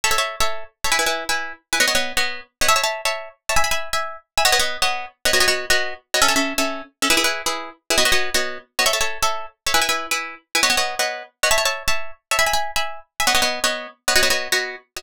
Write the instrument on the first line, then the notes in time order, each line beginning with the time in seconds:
pizzicato strings
0.04 A4 C#5 E5
0.11 A4 C#5 E5
0.18 A4 C#5 E5
0.40 A4 C#5 E5
0.84 A4 C#5 E5
0.92 E4 B4 G#5
0.99 E4 B4 G#5
1.06 E4 B4 G#5
1.29 E4 B4 G#5
1.72 E4 B4 G#5
1.80 B3 C#5 D#5 F#5
1.87 B3 C#5 D#5 F#5
1.95 B3 C#5 D#5 F#5
2.17 B3 C#5 D#5 F#5
2.61 B3 C#5 D#5 F#5
2.68 C#5 E5 A5
2.76 C#5 E5 A5
2.83 C#5 E5 A5
3.05 C#5 E5 A5
3.49 C#5 E5 A5
3.56 E5 G#5 B5
3.64 E5 G#5 B5
3.71 E5 G#5 B5
3.93 E5 G#5 B5
4.37 E5 G#5 B5
4.45 B3 C#5 D#5 F#5
4.52 B3 C#5 D#5 F#5
4.59 B3 C#5 D#5 F#5
4.82 B3 C#5 D#5 F#5
5.25 B3 C#5 D#5 F#5
5.33 B3 F#4 C#5 D#5
5.40 B3 F#4 C#5 D#5
5.48 B3 F#4 C#5 D#5
5.70 B3 F#4 C#5 D#5
6.14 B3 F#4 C#5 D#5
6.21 C#4 A4 E5
6.28 C#4 A4 E5
6.36 C#4 A4 E5
6.58 C#4 A4 E5
7.02 C#4 A4 E5
7.10 E4 G#4 B4
7.17 E4 G#4 B4
7.24 E4 G#4 B4
7.46 E4 G#4 B4
7.90 E4 G#4 B4
7.98 B3 F#4 C#5 D#5
8.05 B3 F#4 C#5 D#5
8.12 B3 F#4 C#5 D#5
8.34 B3 F#4 C#5 D#5
8.79 B3 F#4 C#5 D#5
8.86 A4 C#5 E5
8.93 A4 C#5 E5
9.00 A4 C#5 E5
9.22 A4 C#5 E5
9.66 A4 C#5 E5
9.74 E4 B4 G#5
9.81 E4 B4 G#5
9.89 E4 B4 G#5
10.11 E4 B4 G#5
10.55 E4 B4 G#5
10.63 B3 C#5 D#5 F#5
10.70 B3 C#5 D#5 F#5
10.77 B3 C#5 D#5 F#5
10.99 B3 C#5 D#5 F#5
11.43 B3 C#5 D#5 F#5
11.51 C#5 E5 A5
11.58 C#5 E5 A5
11.65 C#5 E5 A5
11.88 C#5 E5 A5
12.31 C#5 E5 A5
12.39 E5 G#5 B5
12.46 E5 G#5 B5
12.53 E5 G#5 B5
12.76 E5 G#5 B5
13.20 E5 G#5 B5
13.27 B3 C#5 D#5 F#5
13.34 B3 C#5 D#5 F#5
13.42 B3 C#5 D#5 F#5
13.64 B3 C#5 D#5 F#5
14.08 B3 C#5 D#5 F#5
14.15 B3 F#4 C#5 D#5
14.23 B3 F#4 C#5 D#5
14.30 B3 F#4 C#5 D#5
14.52 B3 F#4 C#5 D#5
14.96 B3 F#4 C#5 D#5